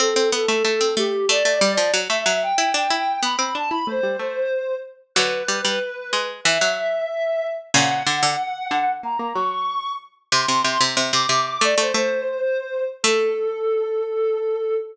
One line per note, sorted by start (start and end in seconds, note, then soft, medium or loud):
0.00 0.14 C4 medium
0.00 0.28 A4 loud
0.16 0.31 C4 medium
0.32 0.46 B3 medium
0.32 0.90 A4 medium
0.48 0.63 A3 medium
0.65 0.80 A3 medium
0.81 0.95 C4 medium
0.97 1.25 A3 medium
0.97 1.26 G4 loud
1.29 1.43 A3 medium
1.29 1.89 D5 loud
1.45 1.60 A3 medium
1.61 1.77 G3 medium
1.77 1.92 F3 medium
1.94 2.08 F#3 medium
2.09 2.25 A3 medium
2.09 2.39 E5 loud
2.26 2.52 F#3 medium
2.42 2.56 G5 loud
2.56 2.73 E4 medium
2.56 2.70 G5 loud
2.74 2.88 D4 medium
2.74 2.90 G5 medium
2.90 3.18 E4 medium
2.90 3.24 G5 loud
3.23 3.36 B3 medium
3.23 3.53 B5 medium
3.39 3.54 C4 medium
3.55 3.70 D4 medium
3.55 3.69 A5 loud
3.70 3.84 E4 medium
3.70 3.86 B5 loud
3.87 4.01 A3 medium
3.87 4.75 C5 loud
4.03 4.17 G3 medium
4.19 4.48 A3 medium
5.15 5.43 D3 medium
5.15 5.43 F#3 medium
5.15 6.20 B4 loud
5.48 5.61 G3 medium
5.65 5.79 G3 medium
6.13 6.41 G#3 medium
6.44 6.58 E3 medium
6.44 7.50 E5 loud
6.61 7.02 F#3 medium
7.74 8.03 A#2 medium
7.74 8.03 C#3 medium
7.74 8.94 F#5 loud
8.07 8.22 D3 medium
8.23 8.36 D3 medium
8.71 9.00 D3 medium
9.03 9.17 A#3 medium
9.03 9.29 A#5 loud
9.19 9.33 A#3 medium
9.34 10.10 F#3 medium
9.34 9.91 C#6 loud
10.32 10.46 C3 medium
10.32 10.84 C6 loud
10.48 10.63 C3 medium
10.64 10.78 C3 medium
10.81 10.96 C3 medium
10.97 11.12 C3 medium
11.13 11.26 C3 medium
11.13 11.44 D6 loud
11.29 11.58 C3 medium
11.47 11.62 D6 loud
11.61 11.75 A3 medium
11.61 11.79 D5 loud
11.78 11.92 A3 medium
11.78 12.84 C5 loud
11.94 12.38 A3 medium
13.03 14.74 A3 loud
13.03 14.74 A4 loud